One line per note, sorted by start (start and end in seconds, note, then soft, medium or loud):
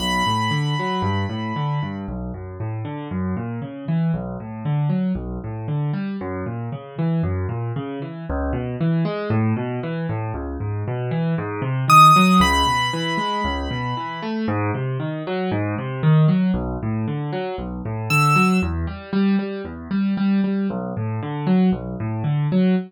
0.00 0.23 B1 medium
0.00 1.96 B5 soft
0.27 0.50 A2 medium
0.51 0.74 D3 medium
0.79 1.03 F#3 medium
1.02 1.25 G2 medium
1.30 1.53 A2 medium
1.56 1.79 D3 medium
1.83 2.06 G2 medium
2.08 2.32 B1 medium
2.34 2.57 F#2 medium
2.60 2.83 A2 medium
2.85 3.08 D3 medium
3.11 3.34 F#2 medium
3.37 3.60 A#2 medium
3.62 3.85 C#3 medium
3.88 4.12 E3 medium
4.14 4.37 B1 medium
4.40 4.63 A2 medium
4.65 4.89 D3 medium
4.89 5.13 F#3 medium
5.15 5.39 B1 medium
5.44 5.67 A2 medium
5.68 5.91 D3 medium
5.93 6.17 G3 medium
6.21 6.44 F#2 loud
6.46 6.70 A#2 medium
6.72 6.96 C#3 medium
6.98 7.22 E3 medium
7.23 7.47 F#2 medium
7.49 7.72 A#2 medium
7.76 7.99 C#3 medium
8.02 8.25 E3 medium
8.30 8.53 C#2 loud
8.53 8.76 B2 medium
8.81 9.04 E3 medium
9.05 9.28 G#3 medium
9.30 9.53 A2 loud
9.57 9.80 B2 medium
9.83 10.07 E3 medium
10.09 10.33 A2 medium
10.34 10.57 C#2 medium
10.60 10.84 G#2 medium
10.88 11.11 B2 medium
11.11 11.35 E3 medium
11.38 11.61 G#2 loud
11.62 11.85 C3 medium
11.88 12.11 D#3 medium
11.88 12.37 D#6 medium
12.16 12.39 F#3 medium
12.40 12.63 C#2 loud
12.40 14.31 B5 medium
12.67 12.90 B2 medium
12.93 13.17 E3 medium
13.18 13.41 G#3 medium
13.45 13.68 C#2 loud
13.71 13.94 B2 medium
13.97 14.20 E3 medium
14.23 14.46 A3 medium
14.48 14.71 G#2 loud
14.75 14.98 C3 medium
15.00 15.23 D#3 medium
15.27 15.50 F#3 medium
15.52 15.75 G#2 loud
15.78 16.02 C3 medium
16.03 16.26 D#3 medium
16.28 16.52 F#3 medium
16.54 16.77 B1 loud
16.83 17.06 A2 medium
17.08 17.31 D3 medium
17.33 17.56 F#3 medium
17.58 17.82 B1 medium
17.85 18.09 A2 medium
18.10 18.34 D3 medium
18.10 18.57 E6 medium
18.36 18.59 F#3 medium
18.62 18.86 E2 loud
18.87 19.10 G3 medium
19.13 19.36 G3 loud
19.39 19.62 G3 medium
19.65 19.88 E2 medium
19.91 20.14 G3 medium
20.17 20.41 G3 medium
20.44 20.67 G3 medium
20.70 20.93 B1 loud
20.97 21.20 A2 medium
21.23 21.46 D3 medium
21.47 21.70 F#3 medium
21.72 21.96 B1 medium
22.00 22.23 A2 medium
22.24 22.47 D3 medium
22.52 22.75 F#3 medium